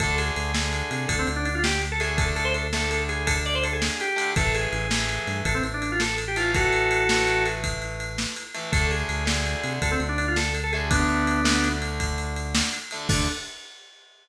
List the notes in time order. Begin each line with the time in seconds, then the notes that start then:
0.00 D2 D3 A3 A4, kick, ride
0.18 G#4, ride
0.36 D2, ride
0.54 D3 A3, snare
0.73 ride
0.91 C3, ride
1.08 D2 A4, kick, ride
1.19 C4
1.27 D2, ride
1.36 D4
1.45 D4, ride
1.55 F4
1.64 G4, snare
1.82 ride
1.92 A4
2.00 D3 A3 G#4, ride
2.17 A4, kick, ride
2.36 A4, ride
2.45 C5
2.54 A4, ride
2.73 D3 A3 A4, snare
2.91 A4, ride
3.09 G#4, ride
3.27 A4, kick, ride
3.45 D5, ride
3.55 C5
3.64 A4, ride
3.73 G#4
3.82 snare
4.00 G4, ride
4.16 D3 A3, ride
4.36 A1 E3 A3 A4, kick, ride
4.55 G#4, ride
4.73 A1, ride
4.90 E3 A3, snare
5.09 ride
5.27 G2, ride
5.45 A1 A4, kick, ride
5.54 C4
5.63 A1, ride
5.74 D4
5.82 D4, ride
5.92 F4
6.00 A4, snare
6.18 ride
6.28 G4
6.36 E3 A3 F4, ride
6.54 F#4 A4, kick, ride
6.73 ride
6.91 ride
7.09 E3 A3, snare
7.27 ride
7.46 ride
7.64 kick, ride
7.82 ride
8.00 ride
8.18 snare
8.36 ride
8.54 E3 A3, ride
8.72 D2 D3 A3 A4, kick, ride
8.91 G#4, ride
9.09 D2, ride
9.25 D3 A3, snare
9.46 ride
9.64 C3, ride
9.82 D2 A4, kick, ride
9.91 C4
10.00 D2, ride
10.09 D4
10.18 D4, ride
10.28 F4
10.36 A4, snare
10.55 ride
10.63 A4
10.73 D3 A3 G#4, ride
10.90 B3 D4, kick, ride
11.09 ride
11.27 ride
11.44 D3 A3, snare
11.64 ride
11.82 ride
12.00 kick, ride
12.18 ride
12.36 ride
12.55 snare
12.73 ride
12.91 D3 A3, ride
13.08 D2 D3 A3 D4, kick, crash